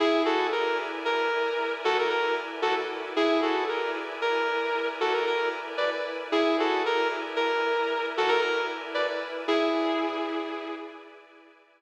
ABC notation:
X:1
M:12/8
L:1/16
Q:3/8=76
K:E
V:1 name="Distortion Guitar"
[EG]2 [FA]2 ^A2 z2 _B6 [F=A] ^A B2 z2 [F=A] z3 | [EG]2 [FA]2 ^A2 z2 _B6 [F=A] ^A A2 z2 [=B=d] z3 | [EG]2 [FA]2 ^A2 z2 _B6 [F=A] ^A A2 z2 [=B=d] z3 | [EG]10 z14 |]
V:2 name="Pad 5 (bowed)"
[EB=dg]24 | [EB=dg]24 | [EB=dg]24 | [EB=dg]24 |]